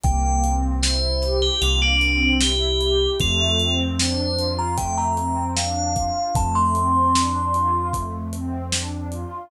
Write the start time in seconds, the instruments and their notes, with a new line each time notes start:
0.03 synth bass 2 C2, pad 2 (warm) A#3, tubular bells G5, kick, closed hi-hat
0.44 pad 2 (warm) C4, closed hi-hat
0.82 pad 2 (warm) E4, tubular bells C5, snare
1.22 pad 2 (warm) G4, snare, closed hi-hat
1.42 tubular bells G4
1.62 synth bass 2 C2, pad 2 (warm) A#3, tubular bells F4, closed hi-hat
1.82 tubular bells D4
2.01 pad 2 (warm) C4, closed hi-hat
2.41 pad 2 (warm) E4, tubular bells G4, snare
2.81 pad 2 (warm) G4, closed hi-hat
3.20 synth bass 2 F2, pad 2 (warm) A3, tubular bells F4, kick, closed hi-hat
3.59 pad 2 (warm) C4, closed hi-hat
4.00 pad 2 (warm) D4, tubular bells C5, snare
4.37 pad 2 (warm) F4, closed hi-hat
4.58 tubular bells A#5
4.78 pad 2 (warm) A3, tubular bells G5, kick, closed hi-hat
4.98 tubular bells A#5
5.17 pad 2 (warm) C4, closed hi-hat
5.57 pad 2 (warm) D4, tubular bells F5, snare
5.95 pad 2 (warm) F4, kick, closed hi-hat
6.35 synth bass 2 F2, pad 2 (warm) A3, tubular bells A5, kick, closed hi-hat
6.55 tubular bells C6
6.74 pad 2 (warm) C4, closed hi-hat
7.15 pad 2 (warm) D4, snare
7.52 pad 2 (warm) F4, closed hi-hat
7.93 pad 2 (warm) A3, kick, closed hi-hat
8.33 pad 2 (warm) C4, closed hi-hat
8.72 pad 2 (warm) D4, snare
9.11 pad 2 (warm) F4, closed hi-hat